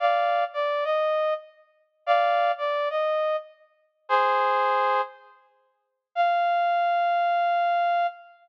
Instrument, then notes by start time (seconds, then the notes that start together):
brass section
0.00 D5 F5
0.53 D5
0.84 D#5
2.06 D5 F5
2.58 D5
2.90 D#5
4.09 G#4 C5
6.15 F5